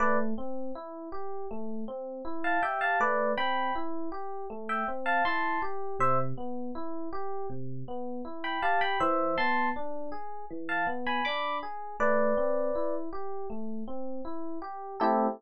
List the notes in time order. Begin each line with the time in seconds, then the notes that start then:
0.00 A3 B4 D5
0.38 C4
0.75 E4
1.12 G4
1.51 A3
1.88 C4
2.25 E4
2.44 F5 A5
2.62 G4 E5 G5
2.81 F5 A5
3.00 A3 B4 D5
3.37 C4 G5 B5
3.75 E4
4.12 G4
4.50 A3
4.69 E5 G5
4.88 C4
5.06 F5 A5
5.25 E4 A5 C6
5.62 G4
5.99 C3 C5 E5
6.38 B3
6.75 E4
7.13 G4
7.50 C3
7.88 B3
8.25 E4
8.44 G5 B5
8.62 G4 F5 A5
8.81 G5 B5
9.00 E3 C5 E5
9.38 B3 A5 C6
9.76 D4
10.12 G#4
10.50 E3
10.69 F5 A5
10.87 B3
11.06 G#5 B5
11.25 D4 B5 D6
11.63 G#4
12.00 A3 B4 D5
12.37 C4
12.75 E4
13.13 G4
13.50 A3
13.88 C4
14.25 E4
14.62 G4
15.00 A3 C4 E4 G4 A4